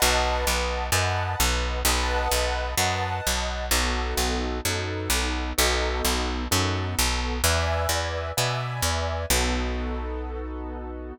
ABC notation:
X:1
M:4/4
L:1/8
Q:"Swing" 1/4=129
K:B
V:1 name="Acoustic Grand Piano"
[Bdf=a]4 [Bdfa]4 | [Bdf=a]4 [Bdfa]4 | [B,DF=A]4 [B,DFA]4 | [B,DF=A]4 [B,DFA]4 |
[B=deg]4 [Bdeg]4 | [B,DF=A]8 |]
V:2 name="Electric Bass (finger)" clef=bass
B,,,2 B,,,2 F,,2 B,,,2 | B,,,2 B,,,2 F,,2 B,,,2 | B,,,2 B,,,2 F,,2 B,,,2 | B,,,2 B,,,2 F,,2 B,,,2 |
E,,2 E,,2 B,,2 E,,2 | B,,,8 |]